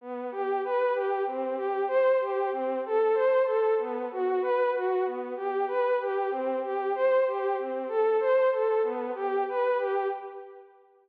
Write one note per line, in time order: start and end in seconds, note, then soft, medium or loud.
0.01 0.30 B3 medium
0.31 0.61 G4 medium
0.64 0.93 B4 medium
0.94 1.24 G4 medium
1.26 1.56 C4 medium
1.56 1.85 G4 medium
1.88 2.17 C5 medium
2.21 2.50 G4 medium
2.52 2.81 C4 medium
2.86 3.15 A4 medium
3.14 3.43 C5 medium
3.45 3.74 A4 medium
3.78 4.08 B3 medium
4.11 4.41 F#4 medium
4.42 4.71 B4 medium
4.75 5.04 F#4 medium
5.05 5.34 B3 medium
5.36 5.65 G4 medium
5.68 5.97 B4 medium
6.01 6.30 G4 medium
6.31 6.60 C4 medium
6.63 6.92 G4 medium
6.95 7.24 C5 medium
7.27 7.56 G4 medium
7.59 7.88 C4 medium
7.88 8.17 A4 medium
8.20 8.49 C5 medium
8.52 8.81 A4 medium
8.83 9.12 B3 medium
9.15 9.44 G4 medium
9.49 9.78 B4 medium
9.79 10.08 G4 medium